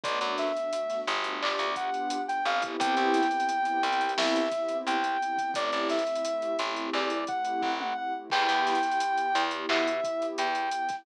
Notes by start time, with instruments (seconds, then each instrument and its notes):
0.03 electric bass (finger) B1, pad 2 (warm) A3 B3 D4 F#4, ocarina D5, kick, closed hi-hat
0.21 electric bass (finger) F#2, closed hi-hat
0.38 ocarina E5, snare, closed hi-hat
0.56 pad 2 (warm) A3 B3 D4 F#4, closed hi-hat
0.72 pad 2 (warm) A3 B3 D4 F#4, closed hi-hat
0.90 snare, closed hi-hat
1.07 electric bass (finger) G1, pad 2 (warm) A3 B3 D4 F#4, closed hi-hat
1.24 closed hi-hat
1.41 pad 2 (warm) B3 D4 F4 G4, ocarina D5, clap
1.59 electric bass (finger) D2, closed hi-hat
1.75 pad 2 (warm) B3 D4 F4 G4, ocarina F#5, kick, closed hi-hat
1.94 closed hi-hat
2.10 closed hi-hat
2.26 pad 2 (warm) B3 D4 F4 G4, ocarina G5, closed hi-hat
2.44 electric bass (finger) G1, pad 2 (warm) B3 C4 E4 G4, ocarina F5, closed hi-hat
2.62 kick, closed hi-hat
2.80 electric bass (finger) C2, ocarina G5, kick, closed hi-hat
2.97 electric bass (finger) C2, closed hi-hat
3.14 snare, closed hi-hat
3.23 closed hi-hat
3.31 pad 2 (warm) B3 C4 E4 G4, closed hi-hat
3.40 closed hi-hat
3.49 pad 2 (warm) B3 C4 E4 G4, closed hi-hat
3.65 closed hi-hat
3.83 electric bass (finger) C2, pad 2 (warm) B3 C4 E4 G4, closed hi-hat
3.92 closed hi-hat
4.01 closed hi-hat
4.09 closed hi-hat
4.18 electric bass (finger) C2, ocarina E5, snare
4.36 closed hi-hat
4.51 pad 2 (warm) B3 C4 E4 G4, kick, closed hi-hat
4.69 closed hi-hat
4.86 electric bass (finger) C2, ocarina G5, closed hi-hat
5.03 pad 2 (warm) B3 C4 E4 G4, closed hi-hat
5.22 pad 2 (warm) B3 C4 E4 G4, closed hi-hat
5.38 pad 2 (warm) B3 C4 E4 G4, kick, closed hi-hat
5.54 electric bass (finger) A1, pad 2 (warm) A3 C4 E4 G4, ocarina D5, kick, closed hi-hat
5.72 electric bass (finger) A1, closed hi-hat
5.89 ocarina E5, snare, closed hi-hat
5.99 closed hi-hat
6.07 pad 2 (warm) A3 C4 E4 G4, closed hi-hat
6.15 closed hi-hat
6.25 pad 2 (warm) A3 C4 E4 G4, closed hi-hat
6.42 closed hi-hat
6.57 electric bass (finger) A1, pad 2 (warm) A3 C4 E4 G4, snare, closed hi-hat
6.76 closed hi-hat
6.93 electric bass (finger) E2, ocarina D5, clap
7.10 closed hi-hat
7.26 pad 2 (warm) A3 C4 E4 G4, ocarina F#5, kick, closed hi-hat
7.45 closed hi-hat
7.62 electric bass (finger) A1, kick
7.80 pad 2 (warm) A3 C4 E4 G4, ocarina F#5, mid tom
7.97 pad 2 (warm) A3 C4 E4 G4, ocarina F#5
8.14 pad 2 (warm) A3 C4 E4 G4
8.30 electric bass (finger) E2, pad 2 (warm) B3 E4 G4, ocarina G5, kick, crash
8.49 electric bass (finger) E2, closed hi-hat
8.67 snare, closed hi-hat
8.75 closed hi-hat
8.83 pad 2 (warm) B3 E4 G4, closed hi-hat
8.92 closed hi-hat
9.00 pad 2 (warm) B3 E4 G4, closed hi-hat
9.18 closed hi-hat
9.34 electric bass (finger) E2, pad 2 (warm) B3 E4 G4, closed hi-hat
9.51 closed hi-hat
9.69 electric bass (finger) B2, ocarina E5, clap
9.87 closed hi-hat
10.03 pad 2 (warm) B3 E4 G4, kick, closed hi-hat
10.22 closed hi-hat
10.38 electric bass (finger) E2, ocarina G5, closed hi-hat
10.55 pad 2 (warm) B3 E4 G4, closed hi-hat
10.71 pad 2 (warm) B3 E4 G4, closed hi-hat
10.89 pad 2 (warm) B3 E4 G4, kick, snare, closed hi-hat